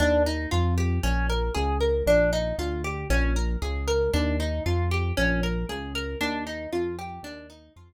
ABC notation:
X:1
M:4/4
L:1/8
Q:1/4=116
K:Ebmix
V:1 name="Acoustic Guitar (steel)"
=D E F G _D B A B | =D E F G _D B A B | =D E F G _D B A B | =D E F G D E F z |]
V:2 name="Synth Bass 1" clef=bass
E,,2 F,,2 B,,,2 D,,2 | B,,,2 =D,,2 B,,,2 _D,,2 | E,,2 F,,2 B,,,2 D,,2 | E,,2 F,,2 E,,2 F,,2 |]